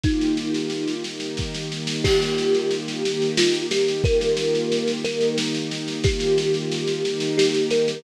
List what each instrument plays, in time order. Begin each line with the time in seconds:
0.04 string ensemble 1 D#3 A#3 F4 G4, kalimba D#4, kick, snare
0.21 snare
0.37 snare
0.54 snare
0.70 snare
0.88 snare
1.04 string ensemble 1 D#3 A#3 D#4 G4, snare
1.20 snare
1.37 kick, snare
1.55 snare
1.72 snare
1.87 snare
2.04 string ensemble 1 D#3 A#3 F4 G4, kalimba G4, kick, snare, crash
2.22 snare
2.38 snare
2.55 snare
2.71 snare
2.88 snare
3.03 string ensemble 1 D#3 A#3 D#4 G4, snare
3.22 snare
3.38 kalimba F4, snare
3.54 snare
3.71 kalimba G4, snare
3.88 snare
4.04 string ensemble 1 D#3 A#3 F4 G4, kalimba A#4, kick, snare
4.21 snare
4.37 snare
4.55 snare
4.72 snare
4.88 snare
5.04 string ensemble 1 D#3 A#3 D#4 G4, kalimba A#4, snare
5.21 snare
5.38 snare
5.55 snare
5.71 snare
5.88 snare
6.04 string ensemble 1 D#3 A#3 F4 G4, kalimba G4, kick, snare
6.20 snare
6.38 snare
6.54 snare
6.72 snare
6.88 snare
7.03 string ensemble 1 D#3 A#3 D#4 G4, snare
7.20 snare
7.38 kalimba G4, snare
7.54 snare
7.71 kalimba A#4, snare
7.88 snare